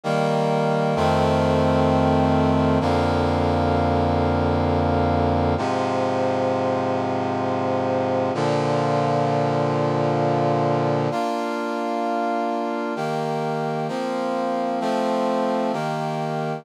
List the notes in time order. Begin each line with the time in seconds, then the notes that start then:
0.03 D#3 G3 A#3
0.96 F2 D#3 A3 C4
2.80 F2 D3 A#3
5.57 G#2 C3 F3
8.34 A#2 D3 F3
11.11 A#3 D4 F4
12.96 D#3 A#3 G4
13.88 F3 A#3 C4
14.80 F3 A3 C4
15.73 D#3 A#3 G4